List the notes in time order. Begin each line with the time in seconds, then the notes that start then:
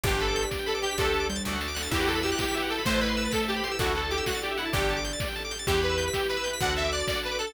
0.04 G1 D4 G4 B4 D5, kick, closed hi-hat
0.14 G5
0.20 A4 B5, closed hi-hat
0.28 D6
0.36 G6, closed hi-hat
0.42 B6
0.51 D5, kick, snare
0.59 G5
0.66 A4 B5, closed hi-hat
0.75 D6
0.82 G4 G6, closed hi-hat
0.91 B6
0.98 D2 D4 G4 A4 D5, kick, closed hi-hat
1.02 A4 G5
1.12 A5, closed hi-hat
1.20 D6
1.29 G3 G6, closed hi-hat
1.36 A6
1.45 D2 D4 F#4 A4 D5, kick, snare
1.53 F#5
1.61 A5, snare
1.68 D6
1.75 F#6, snare
1.82 A6
1.91 E2 E4 F#4 G4 B4 E5, kick, crash
1.95 G4 B4
2.00 F#5
2.07 A4 G5, closed hi-hat
2.15 B5
2.23 G4 E6, closed hi-hat
2.32 F#6
2.38 G4 G6, kick, snare
2.48 B6
2.54 G4 E5, closed hi-hat
2.62 F#5
2.69 A4 G5, closed hi-hat
2.78 B5
2.85 A1 A3 E4 A4 B4 C5 E5, kick, closed hi-hat
2.90 C5 A5
3.01 B4 B5, closed hi-hat
3.08 C6
3.17 E6, closed hi-hat
3.25 A6
3.31 A4 B6, kick, snare
3.42 E5
3.48 G4 A5, closed hi-hat
3.56 B5
3.64 C6, closed hi-hat
3.71 E6
3.79 D2 D4 E4 F#4 A4 D5, kick, closed hi-hat
3.84 A4 E5
3.95 A4 F#5, closed hi-hat
4.03 A5
4.10 G4 D6, closed hi-hat
4.18 E6
4.26 F#4 F#6, kick, snare
4.34 A6
4.42 G4 D5, closed hi-hat
4.51 E5
4.57 E4 F#5, closed hi-hat
4.65 A5
4.73 G1 D4 G4 A4 D5, kick, closed hi-hat
4.82 G5
4.89 A5, closed hi-hat
4.97 D6
5.04 G6, closed hi-hat
5.13 A6
5.20 D5, kick, snare
5.28 G5
5.35 A5, closed hi-hat
5.45 D6
5.51 G6, closed hi-hat
5.59 A6
5.67 E2 E4 G4 B4 E5, kick, closed hi-hat
5.74 G5
5.81 B4 B5, closed hi-hat
5.89 E6
5.98 G6, closed hi-hat
6.08 B6
6.13 G4 E5, kick, snare
6.20 G5
6.28 B4 B5, closed hi-hat
6.37 E6
6.44 G6, closed hi-hat
6.53 B6
6.61 D2 D4 F#4 A4 D5 F#5, kick, closed hi-hat
6.67 F#5
6.76 E5 A5, closed hi-hat
6.84 D6
6.92 D5 F#6, closed hi-hat
7.00 A6
7.07 D5, kick, snare
7.15 F#5
7.23 B4 A5, closed hi-hat
7.31 D6
7.39 A4 F#6, closed hi-hat
7.47 A6